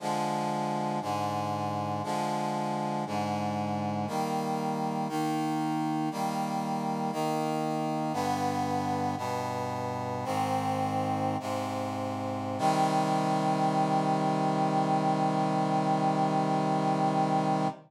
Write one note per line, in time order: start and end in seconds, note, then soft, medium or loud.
0.00 1.00 D3 medium
0.00 1.00 F3 medium
0.00 1.00 G#3 medium
1.01 2.02 G#2 medium
1.01 2.02 D3 medium
1.01 2.02 G#3 medium
2.03 3.04 D3 medium
2.03 3.04 F3 medium
2.03 3.04 G#3 medium
3.06 4.07 G#2 medium
3.06 4.07 D3 medium
3.06 4.07 G#3 medium
4.07 5.08 D#3 medium
4.07 5.08 G3 medium
4.07 5.08 A#3 medium
5.08 6.09 D#3 medium
5.08 6.09 A#3 medium
5.08 6.09 D#4 medium
6.11 7.11 D#3 medium
6.11 7.12 G3 medium
6.11 7.11 A#3 medium
7.12 8.12 D#3 medium
7.12 8.12 A#3 medium
7.12 8.12 D#4 medium
8.12 9.15 G2 medium
8.12 9.15 D3 medium
8.12 9.15 B3 medium
9.17 10.24 G2 medium
9.17 10.24 B2 medium
9.17 10.24 B3 medium
10.24 11.37 G#2 medium
10.24 11.37 D#3 medium
10.24 11.37 C4 medium
11.40 12.58 G#2 medium
11.40 12.58 C3 medium
11.40 12.58 C4 medium
12.58 17.67 C3 loud
12.58 17.67 D#3 loud
12.58 17.67 G3 medium